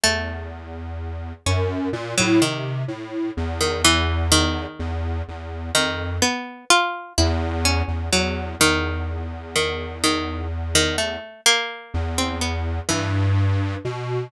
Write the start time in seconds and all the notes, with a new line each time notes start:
0.04 E2 A3
1.46 F#2 C#4
1.93 A#2
2.18 A2 F#3
2.41 C3 D#3
2.88 A2
3.37 E2
3.61 D#3
3.85 E3
4.32 D#3
4.79 E2
5.28 E2
5.75 F2 D#3
6.22 B3
6.70 F4
7.18 E2 E4
7.65 C#4
7.88 E2
8.13 E2 F#3
8.60 E2 D#3
9.56 D#3
10.04 D#3
10.75 D#3
10.98 A3
11.46 A#3
11.94 E2
12.18 C4
12.41 B3
12.89 G2 E3
13.85 B2